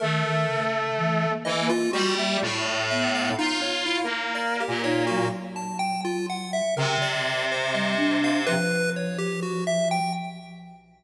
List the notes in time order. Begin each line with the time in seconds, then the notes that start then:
0.00 D#3 A3 A#4
0.25 D#3
0.48 C#3
0.97 E3
1.29 A#3
1.45 E3 D#5
1.61 A#3
1.69 F4
1.93 G3 F#4
2.19 E5
2.42 A2
2.90 B3 E5
3.15 F5
3.39 D#4 F4
3.62 C#5
3.86 E4
4.03 A#3
4.35 D5
4.60 G4
4.68 A#2
4.83 D#4 C#5
5.07 F#3 F#4
5.56 A5
5.79 G5
6.05 F4
6.29 F#5
6.53 E5
6.76 C3 C#3 A#4
7.02 D5
7.51 C5
7.73 G3 D#5
7.97 D4
8.24 F5
8.46 F3 B4
8.96 C#5
9.18 G4
9.43 F#4
9.67 E5
9.91 G5